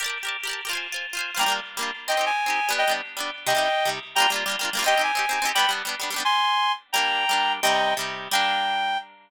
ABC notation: X:1
M:2/2
L:1/16
Q:1/2=173
K:Gphr
V:1 name="Clarinet"
z16 | z16 | [gb]4 z12 | [eg]4 a12 |
[eg]4 z12 | [eg]10 z6 | [gb]4 z12 | [eg]4 a12 |
[g=b]4 z12 | [ac']12 z4 | [gb]16 | [eg]8 z8 |
g16 |]
V:2 name="Orchestral Harp"
[GBd=a] [GBda]4 [GBda]5 [GBda] [GBda]4 [GBda] | [Fca] [Fca]4 [Fca]5 [Fca] [Fca]4 [Fca] | [G,B,DF]2 [G,B,DF]7 [G,B,DF]7 | [CEG]2 [CEG]7 [CEG]5 [G,=B,D]2- |
[G,=B,D]2 [G,B,D]7 [G,B,D]7 | [C,G,E]2 [C,G,E]7 [C,G,E]7 | [G,B,DF]3 [G,B,DF]4 [G,B,DF]3 [G,B,DF]3 [G,B,DF] [G,B,DF]2 | [CEG]3 [CEG]4 [CEG]3 [CEG]3 [CEG] [CEG]2 |
[G,=B,D]3 [G,B,D]4 [G,B,D]3 [G,B,D]3 [G,B,D] [G,B,D]2 | z16 | [G,B,D]8 [G,B,D]8 | [C,G,E]8 [C,G,E]8 |
[G,B,D]16 |]